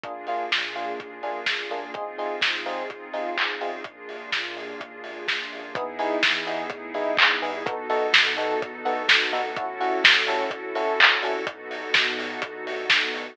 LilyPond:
<<
  \new Staff \with { instrumentName = "Electric Piano 1" } { \time 4/4 \key ees \major \tempo 4 = 126 <bes d' f' aes'>8 <bes d' f' aes'>4 <bes d' f' aes'>4 <bes d' f' aes'>4 <bes d' f' aes'>8 | <c' ees' f' aes'>8 <c' ees' f' aes'>4 <c' ees' f' aes'>4 <c' ees' f' aes'>4 <c' ees' f' aes'>8 | r1 | \key e \major <b dis' e' gis'>8 <b dis' e' gis'>4 <b dis' e' gis'>4 <b dis' e' gis'>4 <b dis' e' gis'>8 |
<b dis' fis' a'>8 <b dis' fis' a'>4 <b dis' fis' a'>4 <b dis' fis' a'>4 <b dis' fis' a'>8 | <cis' e' fis' a'>8 <cis' e' fis' a'>4 <cis' e' fis' a'>4 <cis' e' fis' a'>4 <cis' e' fis' a'>8 | r1 | }
  \new Staff \with { instrumentName = "Synth Bass 2" } { \clef bass \time 4/4 \key ees \major bes,,4 bes,4 ees,8 des,4 des,8 | aes,,4 aes,4 des,8 b,,4 b,,8 | bes,,4 bes,4 ees,8 des,4 des,8 | \key e \major e,4 e4 a,8 g,4 g,8 |
b,,4 b,4 e,8 d,4 d,8 | a,,4 a,4 d,8 c,4 c,8 | b,,4 b,4 e,8 d,4 d,8 | }
  \new Staff \with { instrumentName = "Pad 2 (warm)" } { \time 4/4 \key ees \major <bes d' f' aes'>1 | <c' ees' f' aes'>1 | <bes d' f' aes'>1 | \key e \major <b dis' e' gis'>1 |
<b dis' fis' a'>1 | <cis' e' fis' a'>1 | <b dis' fis' a'>1 | }
  \new DrumStaff \with { instrumentName = "Drums" } \drummode { \time 4/4 <hh bd>8 hho8 <bd sn>8 hho8 <hh bd>8 hho8 <bd sn>8 hho8 | <hh bd>8 hho8 <bd sn>8 hho8 <hh bd>8 hho8 <hc bd>8 hho8 | <hh bd>8 hho8 <bd sn>8 hho8 <hh bd>8 hho8 <bd sn>8 hho8 | <hh bd>8 hho8 <bd sn>8 hho8 <hh bd>8 hho8 <hc bd>8 hho8 |
<hh bd>8 hho8 <bd sn>8 hho8 <hh bd>8 hho8 <bd sn>8 hho8 | <hh bd>8 hho8 <bd sn>8 hho8 <hh bd>8 hho8 <hc bd>8 hho8 | <hh bd>8 hho8 <bd sn>8 hho8 <hh bd>8 hho8 <bd sn>8 hho8 | }
>>